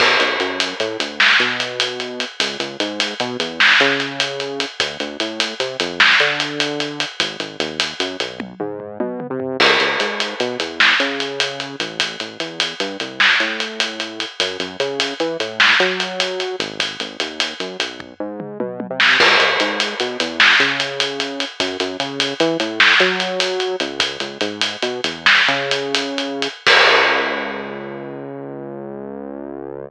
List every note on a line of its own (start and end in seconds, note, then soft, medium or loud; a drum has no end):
0.00 0.17 B1 medium
0.00 kick medium
0.00 crash medium
0.20 0.37 B1 medium
0.20 closed hi-hat medium
0.40 0.74 F#2 medium
0.40 closed hi-hat medium
0.60 closed hi-hat medium
0.80 0.97 A2 medium
0.80 closed hi-hat medium
1.00 1.34 D2 medium
1.00 closed hi-hat medium
1.20 snare medium
1.40 2.25 B2 medium
1.40 closed hi-hat medium
1.60 closed hi-hat medium
1.80 closed hi-hat medium
2.00 closed hi-hat medium
2.20 closed hi-hat medium
2.40 2.57 C#2 medium
2.40 kick medium
2.40 closed hi-hat loud
2.60 2.77 C#2 medium
2.60 closed hi-hat medium
2.80 3.14 G#2 medium
2.80 closed hi-hat medium
3.00 closed hi-hat medium
3.20 3.37 B2 medium
3.20 closed hi-hat medium
3.40 3.74 E2 medium
3.40 closed hi-hat medium
3.60 snare loud
3.80 4.65 C#3 medium
3.80 closed hi-hat medium
4.00 closed hi-hat medium
4.20 closed hi-hat medium
4.40 closed hi-hat medium
4.60 closed hi-hat medium
4.80 4.97 D2 medium
4.80 kick medium
4.80 closed hi-hat medium
5.00 5.17 D2 medium
5.00 closed hi-hat soft
5.20 5.54 A2 medium
5.20 closed hi-hat medium
5.40 closed hi-hat medium
5.60 5.77 C3 medium
5.60 closed hi-hat medium
5.80 6.14 F2 medium
5.80 closed hi-hat medium
6.00 snare medium
6.20 7.05 D3 medium
6.20 closed hi-hat medium
6.40 closed hi-hat medium
6.60 closed hi-hat medium
6.80 closed hi-hat medium
7.00 closed hi-hat medium
7.20 7.37 G#1 medium
7.20 kick medium
7.20 closed hi-hat medium
7.40 7.57 G#1 medium
7.40 closed hi-hat medium
7.60 7.94 D#2 medium
7.60 closed hi-hat medium
7.80 closed hi-hat medium
8.00 8.17 F#2 medium
8.00 closed hi-hat medium
8.20 8.54 B1 medium
8.20 closed hi-hat medium
8.40 kick medium
8.40 high tom medium
8.60 8.98 G#2 medium
8.60 mid tom medium
8.80 floor tom medium
9.00 9.27 B2 medium
9.00 high tom medium
9.20 mid tom medium
9.30 9.57 C3 medium
9.40 floor tom medium
9.60 9.77 C#2 loud
9.60 kick medium
9.60 crash medium
9.80 9.97 C#2 medium
9.80 closed hi-hat medium
10.00 10.34 G#2 medium
10.00 closed hi-hat medium
10.20 closed hi-hat medium
10.40 10.57 B2 medium
10.40 closed hi-hat medium
10.60 10.94 E2 medium
10.60 closed hi-hat medium
10.80 snare medium
11.00 11.76 C#3 medium
11.00 closed hi-hat medium
11.20 closed hi-hat medium
11.40 closed hi-hat medium
11.60 closed hi-hat medium
11.80 12.17 A1 medium
11.80 closed hi-hat medium
12.00 kick medium
12.00 closed hi-hat medium
12.20 12.37 A1 medium
12.20 closed hi-hat medium
12.40 12.74 E2 medium
12.40 closed hi-hat medium
12.60 closed hi-hat medium
12.80 12.97 G2 medium
12.80 closed hi-hat medium
13.00 13.34 C2 medium
13.00 closed hi-hat medium
13.20 snare medium
13.40 14.25 A2 medium
13.40 closed hi-hat soft
13.60 closed hi-hat medium
13.80 closed hi-hat medium
14.00 closed hi-hat medium
14.20 closed hi-hat medium
14.40 14.57 F#2 medium
14.40 kick medium
14.40 closed hi-hat medium
14.60 14.77 F#2 medium
14.60 closed hi-hat medium
14.80 15.14 C#3 medium
14.80 closed hi-hat medium
15.00 closed hi-hat medium
15.20 15.37 E3 medium
15.20 closed hi-hat medium
15.40 15.74 A2 medium
15.40 closed hi-hat medium
15.60 snare medium
15.80 16.56 F#3 medium
15.80 closed hi-hat medium
16.00 closed hi-hat medium
16.20 closed hi-hat medium
16.40 closed hi-hat medium
16.60 16.97 G#1 medium
16.60 closed hi-hat medium
16.80 kick medium
16.80 closed hi-hat medium
17.00 17.17 G#1 medium
17.00 closed hi-hat medium
17.20 17.54 D#2 medium
17.20 closed hi-hat medium
17.40 closed hi-hat medium
17.60 17.77 F#2 medium
17.60 closed hi-hat soft
17.80 18.14 B1 medium
17.80 closed hi-hat medium
18.00 kick medium
18.00 floor tom medium
18.20 18.58 G#2 medium
18.40 mid tom medium
18.60 18.87 B2 medium
18.60 high tom medium
18.80 high tom medium
18.90 19.17 C3 medium
19.00 snare medium
19.20 19.37 C#2 loud
19.20 kick medium
19.20 crash medium
19.40 19.57 C#2 medium
19.40 closed hi-hat medium
19.60 19.94 G#2 medium
19.60 closed hi-hat medium
19.80 closed hi-hat medium
20.00 20.17 B2 medium
20.00 closed hi-hat medium
20.20 20.54 E2 medium
20.20 closed hi-hat medium
20.40 snare medium
20.60 21.45 C#3 medium
20.60 closed hi-hat medium
20.80 closed hi-hat medium
21.00 closed hi-hat medium
21.20 closed hi-hat medium
21.40 closed hi-hat medium
21.60 21.77 F#2 loud
21.60 kick loud
21.60 closed hi-hat medium
21.80 21.97 F#2 medium
21.80 closed hi-hat medium
22.00 22.34 C#3 medium
22.00 closed hi-hat medium
22.20 closed hi-hat medium
22.40 22.57 E3 medium
22.40 closed hi-hat medium
22.60 22.94 A2 medium
22.60 closed hi-hat medium
22.80 snare medium
23.00 23.76 F#3 medium
23.00 closed hi-hat medium
23.20 closed hi-hat medium
23.40 closed hi-hat medium
23.60 closed hi-hat medium
23.80 24.18 C#2 loud
23.80 closed hi-hat medium
24.00 kick medium
24.00 closed hi-hat medium
24.20 24.38 C#2 medium
24.20 closed hi-hat medium
24.41 24.76 G#2 medium
24.41 closed hi-hat medium
24.61 closed hi-hat medium
24.82 25.01 B2 medium
24.82 closed hi-hat medium
25.04 25.42 E2 medium
25.04 closed hi-hat medium
25.26 snare medium
25.48 26.48 C#3 medium
25.48 closed hi-hat soft
25.71 closed hi-hat medium
25.95 closed hi-hat medium
26.18 closed hi-hat medium
26.42 closed hi-hat medium
26.67 29.90 C#2 loud
26.67 kick loud
26.67 crash loud